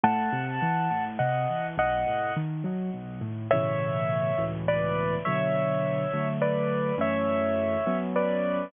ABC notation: X:1
M:6/8
L:1/8
Q:3/8=69
K:E
V:1 name="Acoustic Grand Piano"
[fa]4 [df]2 | [df]2 z4 | [K:A] [ce]4 [Bd]2 | [ce]4 [Bd]2 |
[ce]4 [Bd]2 |]
V:2 name="Acoustic Grand Piano"
A,, =C, E, A,, C, E, | B,,, A,, D, F, B,,, A,, | [K:A] [A,,B,,C,E,]3 [C,,A,,B,,E,]3 | [B,,D,F,]3 [D,F,A,]3 |
[F,,E,A,C]3 [F,B,C]3 |]